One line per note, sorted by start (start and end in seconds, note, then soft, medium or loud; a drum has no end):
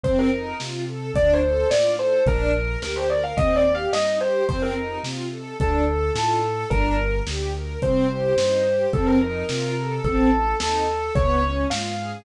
0.03 0.53 F2 medium
0.03 0.30 C4 loud
0.03 0.17 C5 loud
0.03 kick loud
0.03 closed hi-hat loud
0.19 0.55 A#4 medium
0.32 0.57 D#4 medium
0.60 1.11 C3 medium
0.60 0.85 F4 medium
0.60 snare loud
0.87 1.12 A4 medium
1.14 1.64 D2 medium
1.14 1.40 D4 loud
1.14 1.33 D5 loud
1.14 kick loud
1.14 closed hi-hat loud
1.33 1.51 C5 medium
1.43 1.68 A4 medium
1.53 1.70 C5 medium
1.70 2.20 A2 medium
1.70 1.96 F4 medium
1.70 1.93 D5 medium
1.70 snare loud
1.98 2.23 A4 medium
1.98 2.22 C5 medium
2.26 2.76 A#1 medium
2.26 2.52 D4 loud
2.26 2.81 A#4 loud
2.26 kick loud
2.26 closed hi-hat loud
2.55 2.80 A#4 medium
2.81 3.33 D2 medium
2.81 3.06 G4 medium
2.81 2.96 A#4 medium
2.81 snare loud
2.96 3.09 C5 medium
3.09 3.34 A#4 medium
3.09 3.23 D5 medium
3.24 3.37 F5 medium
3.37 3.87 D#2 medium
3.37 3.63 C4 loud
3.37 3.55 D#5 loud
3.37 kick loud
3.37 closed hi-hat loud
3.56 3.73 D5 loud
3.65 3.90 G4 medium
3.75 3.92 F5 medium
3.92 4.42 G2 medium
3.92 4.19 D#4 medium
3.92 4.16 D#5 medium
3.92 snare loud
4.20 4.45 G4 medium
4.20 4.45 C5 loud
4.49 4.99 F2 medium
4.49 4.74 C4 loud
4.49 4.62 C5 loud
4.49 kick loud
4.49 closed hi-hat loud
4.62 4.98 A#4 medium
4.75 5.00 D#4 medium
5.03 5.54 C3 medium
5.03 5.28 F4 medium
5.03 snare loud
5.31 5.56 A4 medium
5.59 6.10 D2 medium
5.59 5.84 D4 loud
5.59 6.09 A4 loud
5.59 kick loud
5.59 closed hi-hat loud
5.88 6.13 A4 medium
6.14 6.65 A2 medium
6.14 6.39 F4 medium
6.14 6.63 A4 medium
6.14 snare loud
6.44 6.69 A4 medium
6.70 7.21 G1 loud
6.70 6.96 D4 loud
6.70 7.16 A#4 loud
6.70 kick loud
6.70 closed hi-hat loud
6.97 7.22 A#4 medium
7.27 7.77 D2 medium
7.27 7.53 G4 medium
7.27 snare loud
7.55 7.80 A#4 medium
7.82 8.33 C2 medium
7.82 8.07 C4 loud
7.82 8.37 C5 medium
7.82 kick loud
7.82 closed hi-hat loud
8.09 8.34 G4 medium
8.37 8.87 G2 medium
8.37 8.64 D#4 medium
8.37 8.85 C5 medium
8.37 snare loud
8.65 8.90 G4 medium
8.93 9.43 F2 loud
8.93 9.19 C4 loud
8.93 9.06 A4 medium
8.93 kick loud
8.93 closed hi-hat medium
9.06 9.20 A#4 loud
9.21 9.46 D#4 medium
9.21 9.94 A#4 medium
9.49 10.00 C3 medium
9.49 9.74 F4 loud
9.49 snare loud
9.77 10.02 A4 medium
10.04 10.54 A1 medium
10.04 10.30 C4 loud
10.04 10.53 A4 loud
10.04 kick loud
10.04 closed hi-hat medium
10.32 10.57 A4 medium
10.60 11.10 D#2 medium
10.60 10.86 D#4 medium
10.60 11.10 A4 medium
10.60 snare loud
10.89 11.14 A4 medium
11.15 11.65 C#2 medium
11.15 11.42 B3 loud
11.15 11.61 C#5 loud
11.15 kick loud
11.15 closed hi-hat loud
11.42 11.67 C#4 medium
11.70 12.21 G#2 medium
11.70 11.95 F4 medium
11.70 12.16 F5 medium
11.70 snare loud
11.98 12.23 G#4 medium